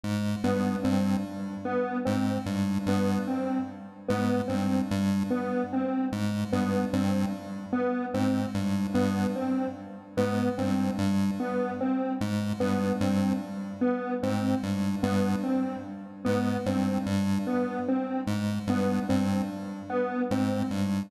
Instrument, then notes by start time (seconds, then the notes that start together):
lead 1 (square)
0.04 G#2
0.44 G2 B3
0.83 G2 C4
1.65 B3
2.05 G#2 C4
2.46 G2
2.86 G2 B3
3.27 C4
4.08 G#2 B3
4.48 G2 C4
4.91 G2
5.31 B3
5.73 C4
6.12 G#2
6.53 G2 B3
6.93 G2 C4
7.73 B3
8.14 G#2 C4
8.54 G2
8.94 G2 B3
9.36 C4
10.17 G#2 B3
10.58 G2 C4
10.98 G2
11.40 B3
11.81 C4
12.21 G#2
12.60 G2 B3
13.01 G2 C4
13.81 B3
14.23 G#2 C4
14.63 G2
15.03 G2 B3
15.43 C4
16.25 G#2 B3
16.66 G2 C4
17.06 G2
17.47 B3
17.88 C4
18.27 G#2
18.67 G2 B3
19.09 G2 C4
19.90 B3
20.31 G#2 C4
20.71 G2